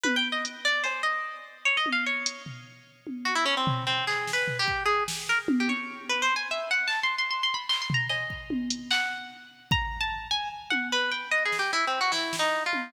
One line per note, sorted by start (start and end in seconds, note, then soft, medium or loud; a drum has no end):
0.03 0.16 B4 medium
0.03 high tom medium
0.16 0.28 G5 loud
0.32 0.44 D#5 medium
0.45 closed hi-hat medium
0.65 0.83 D5 loud
0.84 1.02 C5 medium
0.84 cowbell medium
1.03 1.57 D#5 medium
1.65 1.77 C#5 medium
1.77 1.89 D#5 medium
1.86 high tom medium
1.92 2.05 F5 medium
2.06 2.43 C#5 medium
2.26 closed hi-hat loud
2.46 floor tom medium
3.07 high tom medium
3.25 3.34 F#4 medium
3.35 3.44 E4 loud
3.46 3.55 C#4 loud
3.57 3.84 C4 medium
3.67 floor tom loud
3.87 4.05 C4 medium
4.07 4.31 G#4 medium
4.07 clap medium
4.27 snare medium
4.33 4.57 B4 medium
4.48 floor tom medium
4.59 4.83 G4 loud
4.68 kick medium
4.86 5.04 G#4 medium
5.08 snare medium
5.29 5.38 A#4 medium
5.48 high tom loud
5.60 5.69 G4 medium
5.68 6.05 C#5 medium
5.68 high tom medium
6.09 6.21 B4 medium
6.22 6.34 C5 loud
6.36 6.48 G#5 medium
6.51 6.69 E5 medium
6.71 6.89 F#5 medium
6.88 7.00 A5 loud
6.88 clap medium
7.03 7.15 C6 medium
7.18 7.30 C6 medium
7.31 7.43 C6 medium
7.43 7.55 C6 medium
7.54 7.66 B5 medium
7.69 7.81 C6 medium
7.69 clap medium
7.82 7.94 C6 medium
7.90 floor tom loud
7.94 8.06 A#5 medium
8.09 8.82 D#5 medium
8.09 cowbell medium
8.30 kick medium
8.50 high tom medium
8.70 closed hi-hat medium
8.91 9.63 F#5 loud
8.91 clap medium
9.71 9.99 A#5 medium
9.71 kick loud
10.01 10.28 A5 medium
10.31 10.49 G#5 medium
10.70 10.89 F#5 medium
10.70 high tom medium
10.92 11.10 B4 loud
11.11 11.30 G5 medium
11.31 11.44 D#5 medium
11.45 11.57 G#4 medium
11.52 snare medium
11.59 11.71 G4 medium
11.72 11.85 E4 loud
11.72 cowbell medium
11.87 11.99 C4 medium
12.01 12.13 F#4 medium
12.12 12.36 E4 loud
12.12 snare medium
12.33 snare medium
12.39 12.63 D#4 medium
12.66 12.90 F4 medium
12.73 high tom medium